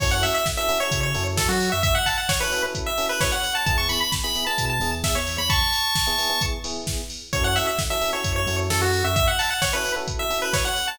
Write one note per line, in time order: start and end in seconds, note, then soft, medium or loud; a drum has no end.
0.00 0.22 F#2 medium
0.00 0.37 C#4 loud
0.00 0.37 E4 loud
0.00 0.37 F#4 loud
0.00 0.37 A4 loud
0.00 0.11 C#5 medium
0.00 kick loud
0.00 crash medium
0.11 0.22 F#5 medium
0.23 0.34 E5 medium
0.23 open hi-hat medium
0.35 0.45 E5 medium
0.46 kick medium
0.46 snare medium
0.57 0.66 C#4 loud
0.57 0.66 E4 loud
0.57 0.66 F#4 medium
0.57 0.66 A4 loud
0.57 0.78 E5 medium
0.69 0.78 C#4 loud
0.69 0.78 E4 loud
0.69 0.78 F#4 loud
0.69 0.78 A4 medium
0.69 open hi-hat medium
0.80 1.08 C#4 loud
0.80 1.08 E4 loud
0.80 1.08 F#4 loud
0.80 1.08 A4 loud
0.80 1.00 C#5 medium
0.91 1.12 C#3 medium
0.91 kick medium
0.91 closed hi-hat loud
1.03 1.24 C#5 medium
1.15 1.36 F#2 medium
1.15 1.51 C#4 loud
1.15 1.51 E4 medium
1.15 1.51 F#4 medium
1.15 1.51 A4 loud
1.15 open hi-hat medium
1.37 1.47 F#2 medium
1.37 1.48 A4 medium
1.37 kick medium
1.37 snare loud
1.48 1.69 F#3 medium
1.48 1.70 F#4 medium
1.60 open hi-hat medium
1.72 1.94 F#2 medium
1.72 1.83 E5 medium
1.83 1.94 E5 loud
1.83 kick medium
1.83 closed hi-hat medium
1.95 2.06 F#5 medium
2.06 2.17 A5 medium
2.06 kick medium
2.06 open hi-hat medium
2.18 2.28 F#5 medium
2.29 2.40 C#5 medium
2.29 kick medium
2.29 snare loud
2.40 2.50 C#4 loud
2.40 2.50 E4 loud
2.40 2.50 F#4 loud
2.40 2.50 A4 loud
2.40 2.62 B4 medium
2.52 2.61 C#4 medium
2.52 2.61 E4 loud
2.52 2.61 F#4 medium
2.52 2.61 A4 medium
2.52 open hi-hat medium
2.63 2.91 C#4 loud
2.63 2.91 E4 medium
2.63 2.91 F#4 medium
2.63 2.91 A4 loud
2.75 kick medium
2.75 closed hi-hat medium
2.86 3.06 E5 medium
2.98 3.34 C#4 loud
2.98 3.34 E4 loud
2.98 3.34 F#4 medium
2.98 3.34 A4 medium
2.98 open hi-hat medium
3.09 3.20 B4 medium
3.21 3.32 C#5 medium
3.21 kick medium
3.21 snare medium
3.32 3.54 F#5 medium
3.43 open hi-hat medium
3.55 3.66 A5 medium
3.66 3.87 E2 medium
3.66 4.03 B3 loud
3.66 4.03 E4 loud
3.66 4.03 G#4 loud
3.66 3.77 A5 medium
3.66 kick medium
3.66 closed hi-hat medium
3.78 3.88 C#6 medium
3.89 4.00 B5 medium
3.89 open hi-hat medium
4.01 4.12 B5 medium
4.12 kick medium
4.12 snare medium
4.24 4.33 B3 medium
4.24 4.33 E4 medium
4.24 4.33 G#4 loud
4.24 4.45 B5 medium
4.35 4.44 B3 loud
4.35 4.44 E4 loud
4.35 4.44 G#4 loud
4.35 open hi-hat medium
4.47 4.74 B3 loud
4.47 4.74 E4 loud
4.47 4.74 G#4 medium
4.47 4.65 A5 medium
4.58 4.79 B2 medium
4.58 kick medium
4.58 closed hi-hat medium
4.70 4.91 A5 medium
4.80 5.00 E2 medium
4.80 5.18 B3 medium
4.80 5.18 E4 medium
4.80 5.18 G#4 loud
4.80 open hi-hat medium
5.04 5.15 E2 medium
5.04 5.15 E5 medium
5.04 kick medium
5.04 snare medium
5.15 5.36 E2 medium
5.15 5.37 C#5 medium
5.27 open hi-hat medium
5.38 5.59 E2 medium
5.38 5.49 B5 medium
5.50 6.42 A5 medium
5.50 6.42 C#6 medium
5.50 kick medium
5.50 closed hi-hat medium
5.73 open hi-hat medium
5.95 kick medium
5.95 snare medium
6.07 6.16 B3 loud
6.07 6.16 E4 loud
6.07 6.16 G#4 loud
6.18 6.28 B3 loud
6.18 6.28 E4 medium
6.18 6.28 G#4 loud
6.18 open hi-hat medium
6.30 6.57 B3 medium
6.30 6.57 E4 medium
6.30 6.57 G#4 medium
6.41 kick medium
6.41 closed hi-hat loud
6.64 7.01 B3 loud
6.64 7.01 E4 loud
6.64 7.01 G#4 loud
6.64 open hi-hat medium
6.87 kick medium
6.87 snare medium
7.10 open hi-hat medium
7.33 7.54 F#2 loud
7.33 7.69 C#4 loud
7.33 7.69 E4 loud
7.33 7.69 F#4 loud
7.33 7.69 A4 loud
7.33 7.44 C#5 medium
7.33 kick medium
7.33 closed hi-hat medium
7.44 7.55 F#5 medium
7.56 7.67 E5 medium
7.56 open hi-hat medium
7.67 7.78 E5 medium
7.79 kick medium
7.79 snare medium
7.90 7.99 C#4 medium
7.90 7.99 E4 medium
7.90 7.99 F#4 medium
7.90 7.99 A4 medium
7.90 8.10 E5 medium
8.01 8.10 C#4 loud
8.01 8.10 E4 medium
8.01 8.10 F#4 medium
8.01 8.10 A4 loud
8.01 open hi-hat medium
8.13 8.40 C#4 loud
8.13 8.40 E4 loud
8.13 8.40 F#4 loud
8.13 8.40 A4 medium
8.13 8.33 C#5 medium
8.24 8.45 F#2 medium
8.24 kick medium
8.24 closed hi-hat medium
8.36 8.56 C#5 medium
8.47 8.67 F#2 medium
8.47 8.84 C#4 loud
8.47 8.84 E4 loud
8.47 8.84 F#4 loud
8.47 8.84 A4 loud
8.47 open hi-hat medium
8.70 8.80 F#2 medium
8.70 8.81 A4 medium
8.70 snare medium
8.81 9.01 F#2 medium
8.81 9.04 F#4 medium
8.93 open hi-hat medium
9.04 9.25 F#2 medium
9.04 9.15 E5 medium
9.16 9.27 E5 loud
9.16 kick medium
9.16 closed hi-hat medium
9.27 9.38 F#5 medium
9.39 9.50 A5 medium
9.39 open hi-hat medium
9.50 9.61 F#5 medium
9.62 9.73 C#5 medium
9.62 kick medium
9.62 snare medium
9.73 9.82 C#4 loud
9.73 9.82 E4 loud
9.73 9.82 F#4 medium
9.73 9.82 A4 loud
9.73 9.92 B4 medium
9.85 9.94 C#4 medium
9.85 9.94 E4 loud
9.85 9.94 F#4 medium
9.85 9.94 A4 loud
9.85 open hi-hat medium
9.96 10.24 C#4 medium
9.96 10.24 E4 medium
9.96 10.24 F#4 loud
9.96 10.24 A4 loud
10.08 kick medium
10.08 closed hi-hat medium
10.19 10.39 E5 medium
10.30 10.67 C#4 medium
10.30 10.67 E4 medium
10.30 10.67 F#4 loud
10.30 10.67 A4 medium
10.30 open hi-hat medium
10.42 10.53 B4 medium
10.53 10.65 C#5 medium
10.53 kick medium
10.53 snare medium
10.65 10.87 F#5 medium
10.76 open hi-hat medium
10.88 10.99 A5 medium